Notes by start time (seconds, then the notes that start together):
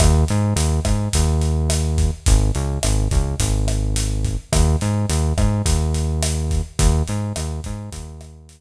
0.00 D#2, kick, cross-stick, closed hi-hat
0.28 G#2, closed hi-hat
0.56 D#2, closed hi-hat
0.85 G#2, kick, cross-stick, closed hi-hat
1.13 D#2, kick, closed hi-hat
1.42 closed hi-hat
1.70 cross-stick, closed hi-hat
1.98 kick, closed hi-hat
2.26 G#1, kick, closed hi-hat
2.55 C#2, closed hi-hat
2.83 G#1, cross-stick, closed hi-hat
3.11 C#2, kick, closed hi-hat
3.40 G#1, kick, closed hi-hat
3.68 cross-stick, closed hi-hat
3.96 closed hi-hat
4.25 kick, closed hi-hat
4.52 D#2, kick, cross-stick, closed hi-hat
4.81 G#2, closed hi-hat
5.09 D#2, closed hi-hat
5.38 G#2, kick, cross-stick, closed hi-hat
5.65 D#2, kick, closed hi-hat
5.94 closed hi-hat
6.23 cross-stick, closed hi-hat
6.51 kick, closed hi-hat
6.79 D#2, kick, closed hi-hat
7.08 G#2, closed hi-hat
7.36 D#2, cross-stick, closed hi-hat
7.64 G#2, kick, closed hi-hat
7.92 D#2, kick, closed hi-hat
8.21 cross-stick, closed hi-hat
8.49 closed hi-hat